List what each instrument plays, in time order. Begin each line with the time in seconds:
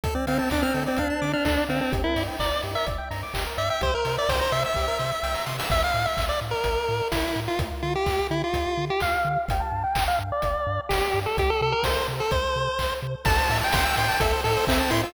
0.04 synth bass 1 D2, lead 1 (square) A4, kick, closed hi-hat
0.15 lead 1 (square) C4 D5
0.27 synth bass 1 D3, lead 1 (square) C4 F5, open hi-hat
0.38 lead 1 (square) C4 A5
0.50 synth bass 1 D2, lead 1 (square) D4 D6, kick, clap
0.62 lead 1 (square) C4 F6
0.74 synth bass 1 D3, lead 1 (square) A4, open hi-hat
0.86 lead 1 (square) C4 D5
0.97 synth bass 1 D2, lead 1 (square) D4 F5, kick, closed hi-hat
1.10 lead 1 (square) A5
1.22 synth bass 1 D3, lead 1 (square) D6, open hi-hat
1.33 lead 1 (square) D4 F6
1.45 synth bass 1 D2, lead 1 (square) D4 A4, kick, clap
1.58 lead 1 (square) D5
1.69 synth bass 1 D3, lead 1 (square) C4 F5, open hi-hat
1.81 lead 1 (square) C4 A5
1.92 synth bass 1 G1, lead 1 (square) G4, kick, closed hi-hat
2.04 lead 1 (square) E4 A#4
2.16 synth bass 1 G2, lead 1 (square) D5, open hi-hat
2.28 lead 1 (square) G5
2.40 synth bass 1 G1, lead 1 (square) D5 A#5, kick, clap
2.52 lead 1 (square) D6
2.63 synth bass 1 G2, lead 1 (square) G4, open hi-hat
2.75 lead 1 (square) A#4 E5
2.87 synth bass 1 G1, lead 1 (square) D5, kick, closed hi-hat
2.98 lead 1 (square) G5
3.11 synth bass 1 G2, lead 1 (square) A#5, open hi-hat
3.23 lead 1 (square) D6
3.34 synth bass 1 G1, lead 1 (square) G4, kick, clap
3.47 lead 1 (square) A#4
3.57 synth bass 1 G2, lead 1 (square) D5 E5, open hi-hat
3.70 lead 1 (square) E5 G5
3.81 synth bass 1 C2, lead 1 (square) G4 C5, kick, closed hi-hat
3.94 lead 1 (square) A#4
4.05 synth bass 1 C3, lead 1 (square) C5, open hi-hat
4.17 lead 1 (square) D5 E5
4.29 synth bass 1 C2, lead 1 (square) C5 G5, kick, snare
4.40 lead 1 (square) C5 A#5
4.52 synth bass 1 C3, lead 1 (square) E5 C6, open hi-hat
4.65 lead 1 (square) E5 E6
4.74 synth bass 1 C2, lead 1 (square) G4, kick, snare
4.88 lead 1 (square) A#4
4.99 synth bass 1 C3, lead 1 (square) C5, snare
5.11 lead 1 (square) E5
5.23 synth bass 1 C2, lead 1 (square) G5, snare
5.34 lead 1 (square) A#5, snare
5.46 synth bass 1 C3, lead 1 (square) C6, snare
5.59 lead 1 (square) E6, snare
5.70 synth bass 1 A1, lead 1 (square) E5, kick, crash
5.84 lead 1 (square) F5
5.94 synth bass 1 A2
6.06 lead 1 (square) E5
6.17 synth bass 1 A1, kick, clap
6.29 lead 1 (square) D5
6.41 synth bass 1 A2
6.51 lead 1 (square) A#4
6.64 synth bass 1 A1, kick, closed hi-hat
6.89 synth bass 1 A2
7.11 synth bass 1 A1, lead 1 (square) E4, kick, snare
7.36 synth bass 1 A2
7.48 lead 1 (square) F4
7.59 synth bass 1 D2, kick, closed hi-hat
7.82 synth bass 1 D3, lead 1 (square) F4
7.95 lead 1 (square) G4
8.06 synth bass 1 D2, kick, clap
8.31 synth bass 1 D3, lead 1 (square) E4
8.44 lead 1 (square) F4
8.53 synth bass 1 D2, kick, closed hi-hat
8.78 synth bass 1 D3
8.90 lead 1 (square) G4
9.00 synth bass 1 D2, lead 1 (square) F5, kick, clap
9.25 synth bass 1 D3
9.49 synth bass 1 G1, lead 1 (square) G5, kick, closed hi-hat
9.60 lead 1 (square) A5
9.72 synth bass 1 G2
9.84 lead 1 (square) G5
9.95 synth bass 1 G1, kick, clap
10.08 lead 1 (square) F5
10.19 synth bass 1 G2
10.32 lead 1 (square) D5
10.42 synth bass 1 G1, kick, closed hi-hat
10.67 synth bass 1 G2
10.89 synth bass 1 G1, lead 1 (square) G4, kick, snare
11.14 synth bass 1 G2
11.26 lead 1 (square) A4
11.38 synth bass 1 C2, lead 1 (square) G4, kick, closed hi-hat
11.50 lead 1 (square) A4
11.61 synth bass 1 C3, lead 1 (square) A4
11.72 lead 1 (square) A#4
11.83 synth bass 1 C2, lead 1 (square) C5, kick, snare
12.08 synth bass 1 C3
12.20 lead 1 (square) A4
12.31 synth bass 1 C2, lead 1 (square) C5, kick, closed hi-hat
12.56 synth bass 1 C3
12.79 synth bass 1 C2, kick, clap
13.03 synth bass 1 C3
13.25 synth bass 1 A1, lead 1 (square) A4 A5, kick, crash
13.38 lead 1 (square) C5
13.49 synth bass 1 A2, lead 1 (square) E5, open hi-hat
13.61 lead 1 (square) G5 A5
13.73 synth bass 1 A1, lead 1 (square) C6, kick, snare
13.85 lead 1 (square) E6
13.96 synth bass 1 A2, lead 1 (square) G5 C6, open hi-hat
14.08 lead 1 (square) A5
14.20 synth bass 1 A1, lead 1 (square) A4 E5, kick, closed hi-hat
14.33 lead 1 (square) C5
14.44 synth bass 1 A2, lead 1 (square) A4, open hi-hat
14.56 lead 1 (square) C5
14.67 synth bass 1 A1, lead 1 (square) C4 E5, kick, clap
14.80 lead 1 (square) A5
14.90 synth bass 1 A2, lead 1 (square) E4 C6, open hi-hat
15.03 lead 1 (square) F4 E6